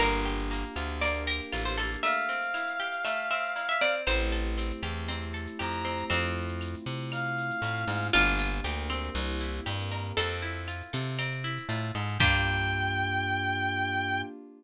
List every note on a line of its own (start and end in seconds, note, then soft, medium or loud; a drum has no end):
0.00 0.64 G1 loud
0.00 0.50 A#3 medium
0.00 1.00 A#3 medium
0.00 1.00 D4 medium
0.00 1.00 F4 medium
0.00 1.00 G4 medium
0.00 0.97 A#4 loud
0.00 crash loud
0.00 cowbell medium
0.00 claves medium
0.13 shaker medium
0.25 1.27 G4 medium
0.25 shaker medium
0.38 shaker medium
0.51 1.01 A#3 medium
0.51 shaker medium
0.64 shaker medium
0.76 1.41 D2 medium
0.76 1.52 F4 medium
0.76 claves medium
0.76 shaker medium
0.89 shaker medium
1.01 1.77 A#3 medium
1.01 2.03 A#3 medium
1.01 2.03 D4 medium
1.01 2.03 G4 medium
1.01 2.03 A#4 medium
1.01 1.23 D5 loud
1.01 cowbell medium
1.01 shaker medium
1.14 shaker medium
1.27 2.00 G4 medium
1.27 1.58 A#4 medium
1.27 shaker medium
1.40 shaker medium
1.52 1.96 A1 medium
1.52 2.01 F4 medium
1.52 cowbell medium
1.52 claves medium
1.52 shaker medium
1.65 1.78 C5 loud
1.65 shaker medium
1.78 2.02 A#3 medium
1.78 1.98 A4 medium
1.78 cowbell medium
1.78 shaker medium
1.91 shaker medium
2.03 3.05 A3 medium
2.03 3.00 E5 loud
2.03 3.95 F5 medium
2.03 cowbell medium
2.03 shaker medium
2.16 shaker medium
2.29 3.30 C4 medium
2.29 shaker medium
2.42 shaker medium
2.54 3.55 E4 medium
2.54 claves medium
2.54 shaker loud
2.67 shaker medium
2.80 4.00 G4 medium
2.80 shaker medium
2.92 shaker medium
3.05 4.02 A3 medium
3.05 3.28 E5 medium
3.05 cowbell medium
3.05 claves medium
3.05 shaker loud
3.18 shaker medium
3.31 3.81 C4 medium
3.31 3.66 E5 loud
3.31 shaker medium
3.43 shaker medium
3.56 4.04 E4 medium
3.56 cowbell medium
3.56 shaker medium
3.69 3.81 E5 loud
3.69 shaker medium
3.81 4.57 C4 medium
3.81 4.02 D5 medium
3.81 cowbell medium
3.81 shaker medium
3.94 shaker medium
4.07 4.72 A1 loud
4.07 6.09 A3 medium
4.07 6.09 C4 medium
4.07 6.09 E4 medium
4.07 6.09 G4 medium
4.07 5.71 C5 loud
4.07 cowbell medium
4.07 claves medium
4.07 shaker loud
4.19 shaker medium
4.32 5.33 A4 medium
4.32 shaker medium
4.45 shaker medium
4.58 5.08 C4 medium
4.58 shaker loud
4.70 shaker medium
4.83 5.47 E2 medium
4.83 5.59 G4 medium
4.83 claves medium
4.83 shaker medium
4.96 shaker medium
5.08 5.84 C4 medium
5.08 cowbell medium
5.08 shaker medium
5.21 shaker medium
5.34 6.06 A4 medium
5.34 shaker medium
5.47 shaker medium
5.59 6.04 F2 medium
5.59 6.08 G4 medium
5.59 6.06 A#5 medium
5.59 cowbell medium
5.59 claves medium
5.59 shaker medium
5.72 shaker medium
5.85 6.09 C4 medium
5.85 cowbell medium
5.85 shaker medium
5.97 shaker medium
6.10 6.75 F2 loud
6.10 8.11 A3 medium
6.10 8.11 C4 medium
6.10 7.30 C4 loud
6.10 8.11 E4 medium
6.10 8.11 F4 medium
6.10 cowbell medium
6.10 shaker medium
6.23 shaker medium
6.36 shaker medium
6.48 shaker medium
6.61 claves medium
6.61 shaker medium
6.74 shaker medium
6.86 7.51 C3 medium
6.86 shaker medium
6.99 shaker medium
7.12 8.07 F5 medium
7.12 cowbell medium
7.12 claves medium
7.12 shaker medium
7.25 shaker medium
7.37 shaker medium
7.50 shaker medium
7.62 7.85 A2 medium
7.62 cowbell medium
7.62 shaker medium
7.75 shaker medium
7.88 8.10 G#2 medium
7.88 cowbell medium
7.88 shaker medium
8.01 shaker medium
8.13 8.61 G1 loud
8.13 8.64 A#3 medium
8.13 9.10 D4 medium
8.13 8.64 D4 medium
8.13 10.10 F4 loud
8.13 8.64 F4 medium
8.13 8.64 G4 medium
8.13 cowbell medium
8.13 claves loud
8.13 shaker medium
8.26 shaker medium
8.39 9.11 F4 medium
8.39 shaker medium
8.52 shaker medium
8.64 9.10 D2 loud
8.64 9.14 A#3 medium
8.64 9.15 D4 medium
8.64 9.13 G4 medium
8.64 9.14 G4 medium
8.64 9.15 A#4 medium
8.64 shaker medium
8.77 shaker medium
8.90 10.12 C4 medium
8.90 claves medium
8.90 shaker medium
9.03 shaker medium
9.15 9.61 C2 loud
9.15 9.65 A#3 medium
9.15 9.65 C4 medium
9.15 9.65 E4 medium
9.15 9.65 G4 medium
9.15 cowbell medium
9.15 shaker medium
9.28 shaker medium
9.41 10.13 E4 medium
9.41 shaker medium
9.53 shaker medium
9.65 10.13 G2 loud
9.65 10.16 A#3 medium
9.65 10.16 C4 medium
9.65 10.16 G4 medium
9.65 10.14 G4 medium
9.65 10.16 A#4 medium
9.65 cowbell medium
9.65 claves medium
9.79 shaker medium
9.92 10.16 A#4 medium
9.92 cowbell medium
9.92 shaker medium
10.04 shaker medium
10.17 10.82 F2 loud
10.17 11.18 C4 medium
10.17 11.33 A4 loud
10.17 cowbell medium
10.17 shaker medium
10.30 shaker medium
10.42 11.44 E4 medium
10.42 shaker medium
10.55 shaker medium
10.68 11.69 F4 medium
10.68 claves medium
10.68 shaker medium
10.81 shaker medium
10.93 11.59 C3 loud
10.93 11.94 A4 medium
10.93 shaker medium
11.06 shaker medium
11.19 12.15 C4 medium
11.19 cowbell medium
11.19 claves medium
11.19 shaker medium
11.31 shaker medium
11.44 12.17 E4 medium
11.44 shaker medium
11.57 shaker medium
11.69 11.92 A2 loud
11.69 12.18 F4 medium
11.69 cowbell medium
11.69 shaker medium
11.82 shaker medium
11.95 12.18 G#2 loud
11.95 12.19 A4 medium
11.95 cowbell medium
11.95 shaker medium
12.08 shaker medium
12.18 14.23 G2 loud
12.18 14.23 A#3 loud
12.18 14.23 D4 loud
12.18 14.23 F4 loud
12.18 14.23 G4 loud
12.18 14.22 G5 loud
12.18 kick loud
12.18 crash loud